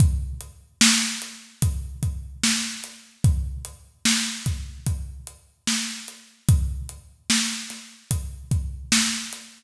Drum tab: HH |xx-xxx-x|xx-xxx-x|xx-xxx-x|
SD |--o---o-|--o---o-|--oo--o-|
BD |o---oo--|o--oo---|o---oo--|